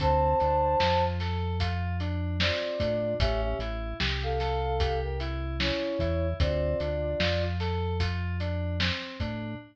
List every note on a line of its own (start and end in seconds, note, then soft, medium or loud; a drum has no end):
0.00 0.35 D2 loud
0.00 0.37 C4 medium
0.00 1.04 C5 medium
0.00 1.04 A5 loud
0.00 kick loud
0.00 closed hi-hat loud
0.40 0.76 D2 medium
0.40 0.77 D4 medium
0.40 closed hi-hat medium
0.80 2.51 F2 medium
0.80 1.17 F4 medium
0.80 snare loud
1.20 1.57 A4 medium
1.20 snare medium
1.20 closed hi-hat medium
1.60 1.97 F4 medium
1.60 kick medium
1.60 closed hi-hat loud
2.00 2.37 D4 medium
2.00 closed hi-hat medium
2.40 2.77 C4 medium
2.40 3.14 F4 medium
2.40 3.14 D5 medium
2.40 snare loud
2.80 3.14 A2 loud
2.80 3.17 D4 medium
2.80 kick medium
2.80 closed hi-hat medium
3.20 3.55 A1 loud
3.20 3.57 C#4 loud
3.20 3.41 G4 medium
3.20 3.41 E5 loud
3.20 kick loud
3.20 closed hi-hat loud
3.43 3.60 G4 medium
3.43 3.60 E5 medium
3.59 3.94 A1 loud
3.59 3.97 E4 medium
3.59 closed hi-hat medium
4.00 5.72 C2 loud
4.00 4.37 G4 medium
4.00 snare loud
4.23 4.99 A4 medium
4.23 4.99 F5 medium
4.40 4.77 A4 medium
4.40 snare medium
4.40 closed hi-hat medium
4.80 5.17 G4 medium
4.80 kick loud
4.80 closed hi-hat loud
5.03 5.20 A#4 medium
5.03 5.20 G5 medium
5.20 5.57 E4 medium
5.20 closed hi-hat medium
5.60 5.97 C#4 medium
5.60 6.27 E4 medium
5.60 6.27 C#5 medium
5.60 snare loud
5.99 6.34 E2 loud
5.99 6.37 E4 medium
5.99 kick medium
5.99 closed hi-hat medium
6.40 6.75 D2 loud
6.40 6.77 C4 medium
6.40 7.43 F4 medium
6.40 7.43 D5 medium
6.40 kick loud
6.40 closed hi-hat loud
6.80 7.15 D2 medium
6.80 7.17 D4 medium
6.80 closed hi-hat medium
7.20 8.91 F2 medium
7.20 7.57 F4 medium
7.20 snare loud
7.60 7.97 A4 medium
7.60 snare medium
7.60 closed hi-hat medium
8.00 8.37 F4 medium
8.00 kick medium
8.00 closed hi-hat loud
8.40 8.77 D4 medium
8.40 closed hi-hat medium
8.80 9.17 C4 medium
8.80 snare loud
9.20 9.55 A2 loud
9.20 9.57 D4 medium
9.20 kick medium
9.20 closed hi-hat medium